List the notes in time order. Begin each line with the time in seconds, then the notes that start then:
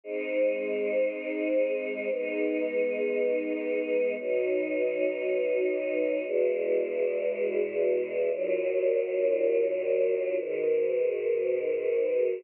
0.04 G#3 C4 D#4
2.10 G#3 B3 D#4
4.18 B2 F#3 D#4
6.25 E2 B2 G#3
8.31 D#2 A#2 F#3
10.37 G#2 B2 D#3